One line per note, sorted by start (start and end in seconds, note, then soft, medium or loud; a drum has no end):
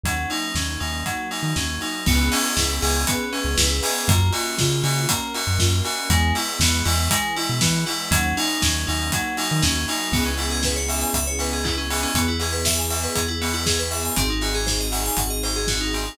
0.03 0.26 D#2 medium
0.03 1.04 F#3 medium
0.03 0.28 F#3 medium
0.03 1.04 A#3 medium
0.03 1.04 C#4 medium
0.03 1.04 D#4 medium
0.03 kick loud
0.03 closed hi-hat loud
0.30 0.53 D#4 loud
0.30 open hi-hat medium
0.55 0.78 D#2 medium
0.55 0.79 C#4 medium
0.55 kick medium
0.55 snare loud
0.80 1.04 D#2 medium
0.80 1.03 D#4 medium
0.80 open hi-hat medium
1.06 2.05 F#3 medium
1.06 1.28 F#3 medium
1.06 2.05 A#3 medium
1.06 2.05 D#4 medium
1.06 2.05 F#4 medium
1.06 kick medium
1.06 closed hi-hat medium
1.31 1.53 D#4 medium
1.31 open hi-hat medium
1.43 1.54 D#3 medium
1.56 1.79 D#2 medium
1.56 1.79 C#4 medium
1.56 kick medium
1.56 snare loud
1.81 2.04 D#4 medium
1.81 open hi-hat medium
2.06 2.30 C#2 loud
2.06 2.30 B3 loud
2.06 3.07 B3 loud
2.06 3.07 C#4 medium
2.06 3.07 E4 medium
2.06 3.07 G#4 medium
2.06 kick loud
2.06 crash loud
2.32 2.54 C#4 loud
2.32 open hi-hat loud
2.57 2.80 C#2 medium
2.57 2.80 E4 medium
2.57 kick medium
2.57 snare loud
2.82 3.05 C#2 loud
2.82 3.05 G#4 medium
2.82 open hi-hat loud
3.07 3.30 B3 loud
3.07 4.08 B3 medium
3.07 4.08 C#4 loud
3.07 4.08 G#4 loud
3.07 4.08 B4 medium
3.07 kick loud
3.07 closed hi-hat loud
3.33 3.55 C#4 medium
3.33 open hi-hat medium
3.44 3.56 C#2 loud
3.57 3.81 C#2 loud
3.57 3.80 E4 medium
3.57 kick medium
3.57 snare loud
3.83 4.06 G#4 medium
3.83 open hi-hat loud
4.08 4.31 F#2 loud
4.08 4.31 A#3 loud
4.08 5.08 A#3 loud
4.08 5.08 C#4 medium
4.08 5.08 F4 medium
4.08 5.08 F#4 medium
4.08 kick loud
4.08 closed hi-hat loud
4.32 4.56 F#4 medium
4.32 open hi-hat medium
4.58 4.83 C#3 loud
4.58 4.81 F4 medium
4.58 kick loud
4.58 snare loud
4.84 5.06 C#3 loud
4.84 5.06 F#4 medium
4.84 open hi-hat medium
5.09 5.32 A#3 loud
5.09 6.10 A#3 medium
5.09 6.10 C#4 loud
5.09 6.10 F#4 medium
5.09 6.10 A#4 loud
5.09 kick loud
5.09 closed hi-hat loud
5.34 5.58 F#4 medium
5.34 open hi-hat medium
5.47 5.58 F#2 medium
5.59 5.82 F#2 loud
5.59 5.82 F4 medium
5.59 kick medium
5.59 snare loud
5.85 6.08 F#4 medium
5.85 open hi-hat medium
6.10 6.32 E2 loud
6.10 7.09 G#3 loud
6.10 6.33 G#3 loud
6.10 7.10 B3 loud
6.10 7.09 E4 loud
6.10 kick loud
6.10 closed hi-hat loud
6.35 6.58 E4 medium
6.35 open hi-hat medium
6.59 6.82 E2 loud
6.59 6.84 B3 loud
6.59 kick loud
6.59 snare loud
6.85 7.09 E2 loud
6.85 7.08 E4 loud
6.85 open hi-hat loud
7.10 8.10 E3 medium
7.10 8.10 G#3 medium
7.10 7.34 G#3 loud
7.10 8.10 E4 medium
7.10 kick loud
7.10 closed hi-hat loud
7.36 7.59 E4 loud
7.36 open hi-hat medium
7.49 7.61 B2 medium
7.61 7.85 E3 loud
7.61 7.84 B3 medium
7.61 kick loud
7.61 snare loud
7.86 8.09 E4 loud
7.86 open hi-hat medium
8.11 8.34 D#2 loud
8.11 9.11 F#3 loud
8.11 8.34 F#3 loud
8.11 9.11 A#3 medium
8.11 9.11 C#4 medium
8.11 9.11 D#4 medium
8.11 kick loud
8.11 closed hi-hat loud
8.37 8.60 D#4 loud
8.37 open hi-hat medium
8.62 8.86 D#2 loud
8.62 8.85 C#4 medium
8.62 kick loud
8.62 snare loud
8.87 9.11 D#2 loud
8.87 9.10 D#4 loud
8.87 open hi-hat medium
9.12 10.13 F#3 medium
9.12 9.36 F#3 loud
9.12 10.13 A#3 loud
9.12 10.13 D#4 medium
9.12 10.13 F#4 loud
9.12 kick loud
9.12 closed hi-hat loud
9.37 9.61 D#4 medium
9.37 open hi-hat medium
9.51 9.63 D#3 loud
9.62 9.86 D#2 loud
9.62 9.85 C#4 loud
9.62 kick loud
9.62 snare loud
9.88 10.12 D#4 loud
9.88 open hi-hat medium
10.12 11.05 C#2 medium
10.12 12.12 B3 loud
10.12 10.24 B3 loud
10.12 12.12 C#4 loud
10.12 12.12 E4 loud
10.12 12.12 G#4 loud
10.12 kick loud
10.12 crash loud
10.26 10.37 C#4 medium
10.38 10.50 E4 medium
10.38 open hi-hat medium
10.51 10.62 G#4 loud
10.63 10.76 B4 loud
10.63 kick medium
10.63 snare loud
10.76 10.87 C#5 medium
10.88 11.01 E5 medium
10.88 open hi-hat medium
11.01 11.12 G#5 medium
11.14 12.06 C#2 medium
11.14 11.25 E5 loud
11.14 kick medium
11.14 closed hi-hat loud
11.27 11.38 C#5 medium
11.39 11.51 B4 medium
11.39 open hi-hat medium
11.53 11.64 G#4 medium
11.64 11.76 E4 loud
11.64 kick medium
11.64 clap loud
11.78 11.89 C#4 medium
11.90 12.02 B3 medium
11.90 open hi-hat loud
12.03 12.14 C#4 medium
12.14 13.07 E2 medium
12.14 14.14 B3 loud
12.14 12.27 B3 loud
12.14 14.14 E4 loud
12.14 14.14 G#4 loud
12.14 kick loud
12.14 closed hi-hat loud
12.28 12.39 E4 medium
12.40 12.52 G#4 medium
12.40 open hi-hat medium
12.52 12.64 B4 medium
12.65 12.77 E5 loud
12.65 kick medium
12.65 snare loud
12.78 12.90 G#5 medium
12.90 13.01 E5 medium
12.90 open hi-hat medium
13.03 13.15 B4 medium
13.15 14.10 E2 medium
13.15 13.26 G#4 medium
13.15 kick medium
13.15 closed hi-hat loud
13.28 13.39 E4 medium
13.41 13.53 B3 loud
13.41 open hi-hat medium
13.54 13.65 E4 medium
13.66 13.78 G#4 loud
13.66 kick medium
13.66 snare loud
13.79 13.90 B4 medium
13.91 14.03 E5 medium
13.91 open hi-hat medium
14.05 14.16 G#5 medium
14.16 15.10 G#1 medium
14.16 16.16 C4 loud
14.16 14.28 C4 loud
14.16 16.16 D#4 loud
14.16 16.16 F#4 loud
14.16 16.16 G#4 loud
14.16 kick loud
14.16 closed hi-hat loud
14.30 14.41 D#4 medium
14.41 14.53 F#4 loud
14.41 open hi-hat medium
14.54 14.66 G#4 medium
14.66 14.78 C5 medium
14.66 kick medium
14.66 snare loud
14.80 14.92 D#5 medium
14.92 15.04 F#5 medium
14.92 open hi-hat medium
15.06 15.17 G#5 medium
15.17 16.10 G#1 medium
15.17 15.29 F#5 medium
15.17 kick medium
15.17 closed hi-hat loud
15.30 15.41 D#5 medium
15.43 15.55 C5 medium
15.43 open hi-hat medium
15.56 15.67 G#4 medium
15.67 15.79 F#4 loud
15.67 kick medium
15.67 snare loud
15.81 15.92 D#4 medium
15.93 16.05 C4 medium
15.93 open hi-hat medium
16.05 16.17 D#4 medium